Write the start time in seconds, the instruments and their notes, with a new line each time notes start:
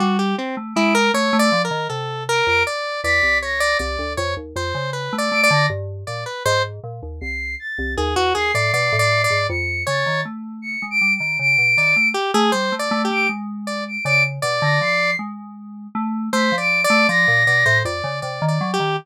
0.00 electric piano 2 G3, lead 1 (square) F#4
0.19 lead 1 (square) G4
0.38 lead 1 (square) C4
0.57 electric piano 2 A3
0.75 electric piano 2 G#3, lead 1 (square) E4, flute D7
0.95 lead 1 (square) A#4
1.14 electric piano 2 A3, lead 1 (square) C#5
1.33 electric piano 2 A3
1.39 lead 1 (square) D5
1.52 electric piano 2 F3
1.65 lead 1 (square) A#4
1.71 electric piano 2 D#3
1.89 electric piano 2 C3, lead 1 (square) A4
2.29 lead 1 (square) A#4, flute D7
2.46 electric piano 2 F2, flute D7
2.67 lead 1 (square) D5
3.03 electric piano 2 E2, lead 1 (square) D5, flute B6
3.23 electric piano 2 C2
3.42 lead 1 (square) C#5, flute A#6
3.60 lead 1 (square) D5
3.79 electric piano 2 C2, lead 1 (square) D5
3.99 electric piano 2 D2
4.17 electric piano 2 F2, lead 1 (square) C#5
4.37 electric piano 2 D#2
4.56 electric piano 2 F2, lead 1 (square) C5
4.75 electric piano 2 C#3
4.93 lead 1 (square) B4
5.13 electric piano 2 A3
5.18 lead 1 (square) D5
5.32 electric piano 2 A3, flute D7
5.43 lead 1 (square) D5
5.51 electric piano 2 D3, flute A#6
5.70 electric piano 2 G2
6.07 electric piano 2 A#2, lead 1 (square) D5
6.26 lead 1 (square) B4
6.45 electric piano 2 G#2, lead 1 (square) C5
6.84 electric piano 2 A#2
7.03 electric piano 2 D#2
7.21 electric piano 2 C2, flute C7
7.59 flute A6
7.78 electric piano 2 C2
7.97 electric piano 2 D#2, lead 1 (square) G#4
8.16 electric piano 2 E2, lead 1 (square) F#4
8.35 electric piano 2 D#2, lead 1 (square) G#4, flute C7
8.54 electric piano 2 A2, lead 1 (square) D5
8.73 electric piano 2 B2, lead 1 (square) D5
8.92 electric piano 2 A2
8.99 lead 1 (square) D5
9.24 lead 1 (square) D5
9.30 electric piano 2 G#2
9.49 electric piano 2 F2, flute C#7
9.87 electric piano 2 C#3, lead 1 (square) C#5, flute A6
10.06 electric piano 2 D#3
10.25 electric piano 2 A3
10.62 flute C#7
10.82 electric piano 2 G#3
10.91 flute D7
11.01 electric piano 2 G3
11.16 flute D7
11.20 electric piano 2 D#3
11.39 electric piano 2 C#3, flute D7
11.58 electric piano 2 B2
11.77 electric piano 2 D#3, lead 1 (square) D5
11.96 electric piano 2 A3
12.14 lead 1 (square) G4
12.34 electric piano 2 A3, lead 1 (square) G#4
12.52 electric piano 2 G3, lead 1 (square) C5
12.72 electric piano 2 A3
12.79 lead 1 (square) D5
12.91 electric piano 2 A3
13.05 lead 1 (square) G4
13.10 electric piano 2 A3, flute D7
13.29 electric piano 2 G#3
13.67 lead 1 (square) D5
13.88 flute D7
14.05 electric piano 2 C#3, lead 1 (square) D5, flute D7
14.42 electric piano 2 B2, lead 1 (square) D5
14.62 electric piano 2 D3, flute A#6
14.81 electric piano 2 F3, flute C7
15.19 electric piano 2 G#3
15.95 electric piano 2 A3
16.33 electric piano 2 A3, lead 1 (square) C5, flute B6
16.52 electric piano 2 F3
16.58 lead 1 (square) D5, flute D7
16.84 lead 1 (square) D5, flute D7
16.90 electric piano 2 A3
17.09 electric piano 2 F3, lead 1 (square) D5, flute A#6
17.28 electric piano 2 A#2
17.47 electric piano 2 B2, lead 1 (square) D5
17.66 electric piano 2 A2, lead 1 (square) C5
17.85 electric piano 2 F2, lead 1 (square) D5
18.04 electric piano 2 C#3
18.22 electric piano 2 C3, lead 1 (square) D5
18.42 electric piano 2 D#3
18.48 lead 1 (square) D5
18.61 electric piano 2 F#3
18.74 lead 1 (square) G4
18.80 electric piano 2 D#3